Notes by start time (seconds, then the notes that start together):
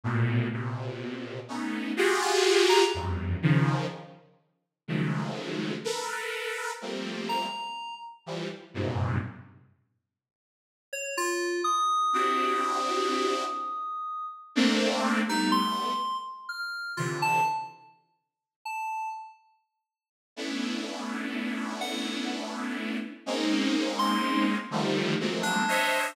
0.04 A2 A#2 B2
0.52 A#2 B2 C3
1.48 A3 B3 C#4 D#4
1.97 F4 F#4 G4 G#4
2.22 F4
2.69 A#5
2.94 E2 F2 F#2 G2
3.42 C#3 D#3 F3
4.88 C#3 D#3 F3 F#3 G#3 A3
5.84 A4 A#4 B4
6.81 F3 G3 A3 A#3 C4
7.29 A#5
8.26 E3 F3 G3
8.74 F#2 G2 G#2 A#2 B2 C3
10.93 C#5
11.17 F4
11.64 D#6
12.13 C4 D4 E4 F#4 G4
14.55 A3 A#3 C4 D4
15.27 G3 A3 B3 D#4
15.52 C6
16.49 F6
16.97 C3 D3 E3 F4
17.22 A5
18.65 A5
20.36 A3 B3 C#4 D4 E4
21.81 F#5
23.26 G#3 A#3 C4 C#4 D#4
23.99 C6
24.71 D3 D#3 F3 G3 A3
25.20 F3 F#3 G#3 A3 A#3 C4
25.43 D4
25.68 C5 C#5 D#5 E5